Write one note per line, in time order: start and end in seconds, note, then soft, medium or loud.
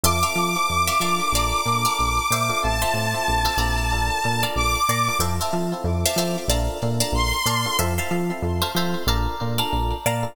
0.03 0.24 F2 loud
0.03 0.20 C4 loud
0.03 0.20 E4 loud
0.03 0.20 F4 loud
0.03 0.20 A4 loud
0.03 0.19 E5 loud
0.03 0.19 F5 loud
0.03 0.19 A5 loud
0.03 0.19 C6 loud
0.03 2.61 D6 medium
0.23 0.49 C4 loud
0.23 0.49 E4 loud
0.23 0.49 F4 loud
0.23 0.49 A4 loud
0.23 0.72 E5 loud
0.23 0.72 F5 loud
0.23 0.72 A5 medium
0.23 0.72 C6 loud
0.35 0.56 F3 loud
0.56 0.94 C4 loud
0.56 0.94 E4 medium
0.56 0.94 F4 loud
0.56 0.94 A4 loud
0.70 0.90 F2 medium
0.87 0.98 E5 loud
0.87 0.98 F5 medium
0.87 0.98 A5 loud
0.87 0.98 C6 loud
1.00 1.20 F3 medium
1.00 1.61 D4 loud
1.00 1.61 F4 loud
1.00 1.61 A4 loud
1.00 1.61 A#4 loud
1.00 1.28 E5 medium
1.00 1.28 F5 loud
1.00 1.28 A5 loud
1.00 1.28 C6 medium
1.32 1.53 A#1 loud
1.32 1.75 D5 loud
1.32 1.75 F5 loud
1.32 1.75 A5 loud
1.37 1.75 A#5 loud
1.66 1.86 A#2 medium
1.66 2.20 D4 medium
1.66 2.20 F4 medium
1.66 2.20 A4 loud
1.66 2.20 A#4 medium
1.85 2.23 D5 loud
1.85 2.23 F5 medium
1.85 2.23 A5 medium
1.85 2.23 A#5 loud
1.99 2.19 A#1 medium
2.31 2.51 A#2 medium
2.31 2.79 C5 loud
2.31 2.79 E5 loud
2.31 2.79 F5 loud
2.31 2.79 A5 loud
2.49 2.60 D4 loud
2.49 2.60 F4 loud
2.49 2.60 A4 loud
2.49 2.60 A#4 loud
2.62 2.84 A1 loud
2.62 2.78 C4 loud
2.62 2.78 E4 loud
2.62 2.78 F4 loud
2.62 2.78 A4 loud
2.62 4.44 A5 medium
2.82 3.06 C4 loud
2.82 3.06 E4 medium
2.82 3.06 F4 loud
2.82 3.06 A4 medium
2.82 3.31 C5 medium
2.82 3.31 E5 loud
2.82 3.31 F5 medium
2.82 3.31 A5 medium
2.94 3.14 A2 medium
3.14 3.51 C4 loud
3.14 3.51 E4 medium
3.14 3.51 F4 medium
3.14 3.51 A4 medium
3.28 3.48 A#1 medium
3.45 3.56 C5 medium
3.45 3.56 E5 loud
3.45 3.56 F5 loud
3.45 3.56 A5 medium
3.57 4.10 A#1 loud
3.57 3.86 C4 loud
3.57 3.86 E4 loud
3.57 3.86 F4 loud
3.57 3.86 A4 loud
3.57 4.30 D5 loud
3.57 4.30 F5 loud
3.57 4.30 A5 loud
3.57 4.30 A#5 loud
3.92 4.19 D4 loud
3.92 4.19 F4 loud
3.92 4.19 A4 loud
3.92 4.19 A#4 loud
4.24 4.45 A#2 medium
4.24 4.78 D4 loud
4.24 4.78 F4 loud
4.24 4.78 A4 loud
4.24 4.78 A#4 loud
4.43 4.81 D5 medium
4.43 4.81 F5 loud
4.43 4.81 A5 medium
4.43 4.81 A#5 medium
4.55 4.76 A#1 medium
4.55 5.18 D6 medium
4.89 5.09 A#2 loud
4.89 5.16 D5 loud
4.89 5.16 F5 loud
4.89 5.16 A5 medium
4.89 5.16 A#5 medium
5.08 5.19 D4 medium
5.08 5.19 F4 loud
5.08 5.19 A4 medium
5.08 5.19 A#4 medium
5.19 5.39 F2 loud
5.19 5.36 C4 loud
5.19 5.36 E4 loud
5.19 5.36 F4 loud
5.19 5.36 A4 loud
5.19 5.35 C5 loud
5.19 5.35 E5 loud
5.19 5.35 F5 loud
5.19 5.35 A5 loud
5.40 5.64 C4 loud
5.40 5.64 E4 medium
5.40 5.64 F4 loud
5.40 5.64 A4 loud
5.40 5.90 C5 medium
5.40 5.90 E5 medium
5.40 5.90 F5 medium
5.40 5.90 A5 medium
5.53 5.73 F3 medium
5.72 6.10 C4 loud
5.72 6.10 E4 loud
5.72 6.10 F4 loud
5.72 6.10 A4 loud
5.84 6.04 F2 loud
6.06 6.16 C5 loud
6.06 6.16 E5 loud
6.06 6.16 F5 loud
6.06 6.16 A5 loud
6.16 6.36 F3 medium
6.16 6.45 C4 medium
6.16 6.45 E4 medium
6.16 6.45 F4 loud
6.16 6.45 A4 loud
6.16 6.45 C5 medium
6.16 6.45 E5 loud
6.16 6.45 F5 loud
6.16 6.45 A5 medium
6.48 6.68 A#1 loud
6.48 6.77 D4 loud
6.48 6.77 F4 loud
6.48 6.77 A4 loud
6.48 6.77 A#4 loud
6.48 6.89 D5 loud
6.48 6.89 F5 loud
6.48 6.89 A5 loud
6.48 6.89 A#5 loud
6.82 7.03 A#2 medium
6.82 7.36 D4 loud
6.82 7.36 F4 medium
6.82 7.36 A4 medium
6.82 7.36 A#4 medium
7.00 7.38 D5 medium
7.00 7.38 F5 loud
7.00 7.38 A5 loud
7.00 7.38 A#5 loud
7.12 7.32 A#1 loud
7.12 7.77 C6 medium
7.46 7.66 A#2 medium
7.46 7.73 D5 medium
7.46 7.73 F5 medium
7.46 7.73 A5 loud
7.46 7.73 A#5 medium
7.66 7.77 D4 medium
7.66 7.77 F4 medium
7.66 7.77 A4 loud
7.66 7.77 A#4 loud
7.79 7.99 F2 loud
7.79 7.94 C4 loud
7.79 7.94 E4 loud
7.79 7.94 F4 loud
7.79 7.94 A4 loud
7.79 7.94 C5 loud
7.79 7.94 E5 loud
7.79 7.94 F5 loud
7.79 7.94 A5 loud
7.98 8.22 C4 loud
7.98 8.22 E4 loud
7.98 8.22 F4 medium
7.98 8.22 A4 loud
7.98 8.47 C5 loud
7.98 8.47 E5 loud
7.98 8.47 F5 loud
7.98 8.47 A5 loud
8.11 8.31 F3 medium
8.30 8.67 C4 medium
8.30 8.67 E4 medium
8.30 8.67 F4 medium
8.30 8.67 A4 loud
8.42 8.63 F2 medium
8.62 8.72 C5 loud
8.62 8.72 E5 medium
8.62 8.72 F5 medium
8.62 8.72 A5 loud
8.75 8.95 F3 medium
8.75 9.03 C4 loud
8.75 9.03 E4 loud
8.75 9.03 F4 loud
8.75 9.03 A4 loud
8.75 9.03 C5 loud
8.75 9.03 E5 medium
8.75 9.03 F5 loud
8.75 9.03 A5 medium
9.07 9.27 A#1 loud
9.07 9.35 D4 loud
9.07 9.35 F4 loud
9.07 9.35 A4 loud
9.07 9.35 A#4 loud
9.07 9.48 D5 loud
9.07 9.48 F5 loud
9.07 9.48 A5 loud
9.07 9.48 A#5 loud
9.40 9.61 A#2 medium
9.40 9.94 D4 loud
9.40 9.94 F4 loud
9.40 9.94 A4 medium
9.40 9.94 A#4 loud
9.58 9.96 D5 loud
9.58 9.96 F5 medium
9.58 9.96 A5 loud
9.58 9.96 A#5 medium
9.73 9.93 A#1 medium
10.06 10.26 A#2 medium
10.06 10.33 D5 loud
10.06 10.33 F5 loud
10.06 10.33 A5 medium
10.06 10.33 A#5 loud
10.23 10.34 D4 loud
10.23 10.34 F4 loud
10.23 10.34 A4 medium
10.23 10.34 A#4 loud